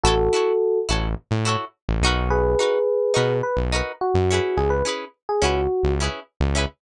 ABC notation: X:1
M:4/4
L:1/16
Q:1/4=106
K:C#m
V:1 name="Electric Piano 1"
[FA]6 z10 | [GB]8 B z3 F4 | G B z3 G F4 z6 |]
V:2 name="Acoustic Guitar (steel)"
[EFAc]2 [EFAc]4 [EFAc]4 [EFAc]4 [DF^AB]2- | [DF^AB]2 [DFAB]4 [DFAB]4 [DFAB]4 [CEGB]2- | [CEGB]2 [CEGB]4 [CEGB]4 [CEGB]4 [CEGB]2 |]
V:3 name="Synth Bass 1" clef=bass
A,,,6 A,,,3 A,,4 A,,, B,,,2- | B,,,6 B,,3 B,,,4 F,,3 | C,,6 C,,3 C,,4 C,,3 |]